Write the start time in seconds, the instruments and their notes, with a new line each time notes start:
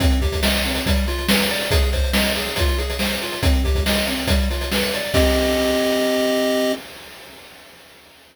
0.00 lead 1 (square) C4, kick, closed hi-hat
0.10 closed hi-hat
0.21 lead 1 (square) G4, kick, closed hi-hat
0.32 kick, closed hi-hat
0.43 lead 1 (square) D#5, snare
0.54 closed hi-hat
0.65 lead 1 (square) C4, closed hi-hat
0.75 closed hi-hat
0.86 lead 1 (square) G3, kick, closed hi-hat
0.96 closed hi-hat
1.07 lead 1 (square) F4, closed hi-hat
1.18 closed hi-hat
1.28 lead 1 (square) B4, snare
1.40 closed hi-hat
1.49 lead 1 (square) D5, closed hi-hat
1.61 closed hi-hat
1.71 lead 1 (square) G#4, kick, closed hi-hat
1.82 closed hi-hat
1.92 lead 1 (square) C5, kick, closed hi-hat
2.04 closed hi-hat
2.13 lead 1 (square) D#5, snare
2.25 closed hi-hat
2.35 lead 1 (square) G#4, closed hi-hat
2.46 closed hi-hat
2.56 lead 1 (square) F4, kick, closed hi-hat
2.68 closed hi-hat
2.78 lead 1 (square) G#4, closed hi-hat
2.90 closed hi-hat
2.99 lead 1 (square) C5, snare
3.11 closed hi-hat
3.22 lead 1 (square) F4, closed hi-hat
3.32 closed hi-hat
3.43 lead 1 (square) C4, kick, closed hi-hat
3.53 closed hi-hat
3.64 lead 1 (square) G4, kick, closed hi-hat
3.75 kick, closed hi-hat
3.86 lead 1 (square) D#5, snare
3.95 closed hi-hat
4.07 lead 1 (square) C4, closed hi-hat
4.17 closed hi-hat
4.27 lead 1 (square) G3, kick, closed hi-hat
4.39 closed hi-hat
4.50 lead 1 (square) F4, closed hi-hat
4.61 closed hi-hat
4.72 lead 1 (square) B4, snare
4.82 closed hi-hat
4.93 lead 1 (square) D5, closed hi-hat
5.04 closed hi-hat
5.14 lead 1 (square) C4 G4 D#5, kick, crash